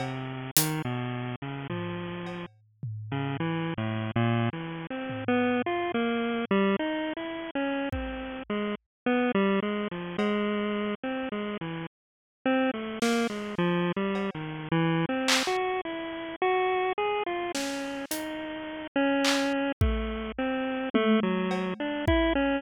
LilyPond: <<
  \new Staff \with { instrumentName = "Lead 1 (square)" } { \time 4/4 \tempo 4 = 53 c8 dis16 b,8 cis16 f8. r8 cis16 \tuplet 3/2 { e8 a,8 ais,8 } | \tuplet 3/2 { e8 c'8 b8 } f'16 ais8 g16 \tuplet 3/2 { dis'8 e'8 cis'8 } c'8 gis16 r16 | b16 g16 gis16 f16 gis8. c'16 gis16 e16 r8 c'16 a16 ais16 gis16 | \tuplet 3/2 { f8 g8 dis8 e8 c'8 fis'8 } e'8 fis'8 gis'16 f'16 cis'8 |
dis'8. cis'8. a8 c'8 a16 fis8 d'16 e'16 cis'16 | }
  \new DrumStaff \with { instrumentName = "Drums" } \drummode { \time 4/4 cb8 hh8 r8 tomfh8 cb8 tomfh8 r4 | r8 tomfh8 r4 r4 bd4 | r4 cb4 r4 r8 sn8 | r8 cb8 r8 hc8 r4 r8 sn8 |
hh4 hc8 bd8 r8 tommh8 cb8 bd8 | }
>>